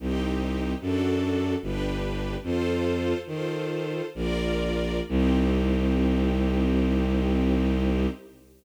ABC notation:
X:1
M:3/4
L:1/8
Q:1/4=74
K:Cm
V:1 name="String Ensemble 1"
[CEG]2 [D^F=A]2 [DG=B]2 | "^rit." [F=Ac]2 [FAc]2 [FBd]2 | [CEG]6 |]
V:2 name="Violin" clef=bass
C,,2 ^F,,2 G,,,2 | "^rit." F,,2 E,2 B,,,2 | C,,6 |]